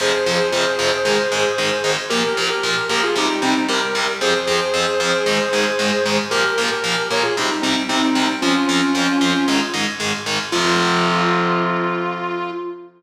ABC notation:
X:1
M:4/4
L:1/16
Q:1/4=114
K:Fm
V:1 name="Distortion Guitar"
[Ac]16 | [GB]3 [GB]3 [GB] [FA] [EG]2 [CE]2 [GB]4 | [Ac]16 | [GB]3 [GB]3 [Bd] [FA] [EG]2 [CE]2 [CE]4 |
[DF]10 z6 | F16 |]
V:2 name="Overdriven Guitar"
[F,,C,F,]2 [F,,C,F,]2 [F,,C,F,]2 [F,,C,F,]2 [A,,E,A,]2 [A,,E,A,]2 [A,,E,A,]2 [A,,E,A,]2 | [B,,F,B,]2 [B,,F,B,]2 [B,,F,B,]2 [B,,F,B,]2 [C,G,C]2 [C,G,C]2 [C,G,C]2 [C,G,C]2 | [F,,F,C]2 [F,,F,C]2 [F,,F,C]2 [F,,F,C]2 [A,,E,A,]2 [A,,E,A,]2 [A,,E,A,]2 [A,,E,A,]2 | [B,,F,B,]2 [B,,F,B,]2 [B,,F,B,]2 [B,,F,B,]2 [C,G,C]2 [C,G,C]2 [C,G,C]2 [C,G,C]2 |
[F,,F,C]2 [F,,F,C]2 [F,,F,C]2 [F,,F,C]2 [A,,E,A,]2 [A,,E,A,]2 [A,,E,A,]2 [A,,E,A,]2 | [F,,C,F,]16 |]